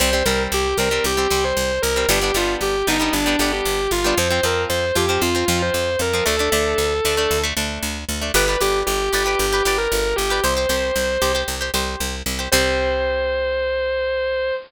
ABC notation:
X:1
M:4/4
L:1/16
Q:1/4=115
K:Cdor
V:1 name="Distortion Guitar"
c2 B z G2 B2 G3 c3 B2 | G2 F z G2 E2 D3 G3 F2 | c2 B z c2 G2 F3 c3 B2 | A10 z6 |
=B2 G z G2 G2 G3 _B3 G2 | c8 z8 | c16 |]
V:2 name="Acoustic Guitar (steel)"
[G,C] [G,C] [G,C]4 [G,C] [G,C]2 [G,C] [G,C]5 [G,C] | [G,=B,D] [G,B,D] [G,B,D]4 [G,B,D] [G,B,D]2 [G,B,D] [G,B,D]5 [G,B,D] | [F,C] [F,C] [F,C]4 [F,C] [F,C]2 [F,C] [F,C]5 [F,C] | [A,D] [A,D] [A,D]4 [A,D] [A,D]2 [A,D] [A,D]5 [A,D] |
[G=Bd] [GBd] [GBd]4 [GBd] [GBd]2 [GBd] [GBd]5 [GBd] | [Gc] [Gc] [Gc]4 [Gc] [Gc]2 [Gc] [Gc]5 [Gc] | [G,C]16 |]
V:3 name="Electric Bass (finger)" clef=bass
C,,2 C,,2 C,,2 C,,2 C,,2 C,,2 C,,2 C,,2 | G,,,2 G,,,2 G,,,2 G,,,2 G,,,2 G,,,2 G,,,2 G,,,2 | F,,2 F,,2 F,,2 F,,2 F,,2 F,,2 F,,2 F,,2 | D,,2 D,,2 D,,2 D,,2 D,,2 D,,2 D,,2 D,,2 |
G,,,2 G,,,2 G,,,2 G,,,2 G,,,2 G,,,2 G,,,2 G,,,2 | C,,2 C,,2 C,,2 C,,2 C,,2 C,,2 C,,2 C,,2 | C,,16 |]